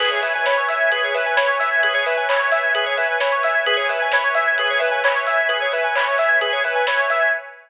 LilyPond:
<<
  \new Staff \with { instrumentName = "Drawbar Organ" } { \time 4/4 \key cis \minor \tempo 4 = 131 b'16 cis''16 e''16 gis''16 b''16 cis'''16 e'''16 gis'''16 b'16 cis''16 e''16 gis''16 b''16 cis'''16 e'''16 gis'''16 | b'16 cis''16 e''16 gis''16 b''16 cis'''16 e'''16 gis'''16 b'16 cis''16 e''16 gis''16 b''16 cis'''16 e'''16 gis'''16 | b'16 cis''16 e''16 gis''16 b''16 cis'''16 e'''16 gis'''16 b'16 cis''16 e''16 gis''16 b''16 cis'''16 e'''16 gis'''16 | b'16 cis''16 e''16 gis''16 b''16 cis'''16 e'''16 gis'''16 b'16 cis''16 e''16 gis''16 b''16 cis'''16 e'''16 gis'''16 | }
  \new Staff \with { instrumentName = "Lead 1 (square)" } { \time 4/4 \key cis \minor gis'8 b'8 cis''8 e''8 gis'8 b'8 cis''8 e''8 | gis'8 b'8 cis''8 e''8 gis'8 b'8 cis''8 e''8 | gis'8 b'8 cis''8 e''8 gis'8 b'8 cis''8 e''8 | gis'8 b'8 cis''8 e''8 gis'8 b'8 cis''8 e''8 | }
  \new Staff \with { instrumentName = "Synth Bass 2" } { \clef bass \time 4/4 \key cis \minor cis,8. gis,8. cis,4 cis,8. cis,8.~ | cis,1 | cis,8. gis,8. cis,4 cis8. cis,8.~ | cis,1 | }
  \new Staff \with { instrumentName = "Pad 5 (bowed)" } { \time 4/4 \key cis \minor <b' cis'' e'' gis''>1~ | <b' cis'' e'' gis''>1 | <b' cis'' e'' gis''>1~ | <b' cis'' e'' gis''>1 | }
  \new DrumStaff \with { instrumentName = "Drums" } \drummode { \time 4/4 <cymc bd>8 hho8 <bd sn>8 hho8 <hh bd>8 hho8 <bd sn>8 hho8 | <hh bd>8 hho8 <hc bd>8 hho8 <hh bd>8 hho8 <bd sn>8 hho8 | <hh bd>8 hho8 <bd sn>8 hho8 <hh bd>8 hho8 <hc bd>8 hho8 | <hh bd>8 hho8 <hc bd>8 hho8 <hh bd>8 hho8 <bd sn>8 hho8 | }
>>